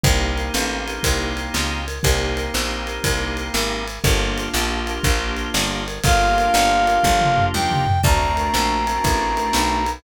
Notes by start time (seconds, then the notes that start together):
0.04 C2 A#3 C4 D#4 G4, kick, ride
0.38 ride
0.54 A1, snare
0.88 ride
1.03 C2, kick, ride
1.37 ride
1.54 C#2, snare
1.88 ride
2.03 C2 A#3 C4 D#4 G4, kick, ride
2.37 ride
2.54 A#1, snare
2.87 ride
3.04 C2, kick, ride
3.37 ride
3.54 G#1, snare
3.88 ride
4.04 G1 A#3 D4 F4 G4, kick, ride
4.38 ride
4.54 A#1, snare
4.87 ride
5.03 A#1, kick, ride
5.37 ride
5.54 G1, snare
5.88 ride
6.04 G1 A#3 D4 F4 G4 F5, kick, ride
6.38 ride
6.54 G1, snare
6.87 ride
7.03 G1, kick, high tom
7.21 mid tom
7.38 floor tom
7.54 D#2 G5, high tom
7.71 mid tom
7.87 floor tom
8.03 D2 A3 C4 D4 F#4 A#5, kick, crash
8.37 ride
8.54 A#1, snare
8.87 ride
9.04 A1, kick, ride
9.37 ride
9.53 B1, snare
9.86 ride